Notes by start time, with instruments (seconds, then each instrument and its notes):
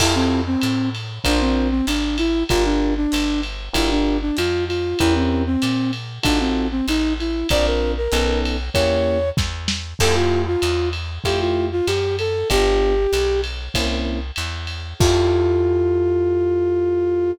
0.00 electric bass (finger) F2, flute E4, electric piano 1 E4 F4 G4 A4, kick, crash, ride
0.15 flute C4
0.47 flute C4
0.61 electric bass (finger) A2, hi-hat pedal, ride
0.95 ride
1.24 electric bass (finger) A#1, electric piano 1 D4 F4 A#4 C5, flute D4, kick, ride
1.41 flute C4
1.71 flute C4
1.87 electric bass (finger) G#1, flute D4, hi-hat pedal, ride
2.18 flute E4, ride
2.49 electric bass (finger) G1, electric piano 1 D4 F4 G4 A#4, flute F4, kick, ride
2.65 flute D4
2.97 flute D4
3.12 electric bass (finger) G1, hi-hat pedal, ride
3.43 ride
3.73 electric bass (finger) G1, electric piano 1 D4 F4 G4 A#4, flute E4, kick, ride
3.91 flute D4
4.22 flute D4
4.37 electric bass (finger) F2, flute F4, hi-hat pedal, ride
4.68 flute F4, ride
4.99 electric bass (finger) E2, electric piano 1 C#4 E4 G4 A#4, flute E4, kick, ride
5.15 flute C4
5.46 flute C4
5.62 electric bass (finger) A#2, hi-hat pedal, ride
5.93 ride
6.23 electric bass (finger) A1, flute D4, electric piano 1 D#4 F4 F#4 A4, kick, ride
6.40 flute C4
6.71 flute C4
6.88 electric bass (finger) A1, flute D#4, hi-hat pedal, ride
7.20 flute E4, ride
7.49 electric bass (finger) A#1, electric piano 1 C4 D4 F4 A#4, flute D5, kick, ride
7.66 flute A#4
7.98 flute A#4
8.12 electric bass (finger) B1, electric piano 1 B3 C#4 D#4 A4, hi-hat pedal, ride
8.45 ride
8.74 electric bass (finger) E2, electric piano 1 A#3 C#4 E4 G4, flute C#5, kick, ride
9.37 electric bass (finger) E2, kick, snare
9.68 snare
9.99 electric bass (finger) F2, electric piano 1 A3 E4 F4 G4, flute A4, kick, crash, ride
10.16 flute F4
10.47 flute F4
10.62 electric bass (finger) E2, hi-hat pedal, ride
10.93 ride
11.24 electric bass (finger) F2, electric piano 1 A3 E4 F4 G4, flute G4, kick, ride
11.41 flute F4
11.72 flute F4
11.87 electric bass (finger) F#2, flute G4, hi-hat pedal, ride
12.19 flute A4, ride
12.50 electric bass (finger) G1, electric piano 1 B3 D4 F4 G4, flute G4, kick, ride
13.13 electric bass (finger) B1, hi-hat pedal, ride
13.44 ride
13.74 electric bass (finger) C2, electric piano 1 A#3 C4 C#4 E4, kick, ride
14.36 electric bass (finger) E2, hi-hat pedal, ride
14.67 ride
14.99 electric bass (finger) F2, electric piano 1 E4 F4 G4 A4, flute F4, kick, crash